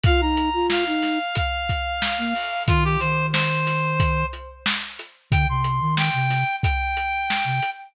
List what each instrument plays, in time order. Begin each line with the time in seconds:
0.04 flute F4, clarinet F5, kick, closed hi-hat
0.21 flute D#4, clarinet A#5
0.37 closed hi-hat
0.54 flute F4
0.70 clarinet F5, snare
0.87 flute D#4
1.02 snare, closed hi-hat
1.35 clarinet F5, kick, closed hi-hat
1.69 kick, closed hi-hat
2.02 snare
2.18 flute A#3
2.35 open hi-hat
2.66 flute D#3, clarinet F4, kick, closed hi-hat
2.85 clarinet G4
3.00 flute D#3, clarinet C5, closed hi-hat
3.33 clarinet C5, snare
3.67 snare, closed hi-hat
4.00 kick, closed hi-hat
4.33 closed hi-hat
4.66 snare
4.99 closed hi-hat
5.30 flute D3, clarinet G5, kick, closed hi-hat
5.48 flute C3, clarinet C6
5.64 closed hi-hat
5.81 flute D#3
5.97 clarinet G5, snare
6.13 flute C3
6.30 snare, closed hi-hat
6.63 clarinet G5, kick, closed hi-hat
6.97 closed hi-hat
7.30 snare
7.45 flute C3
7.63 closed hi-hat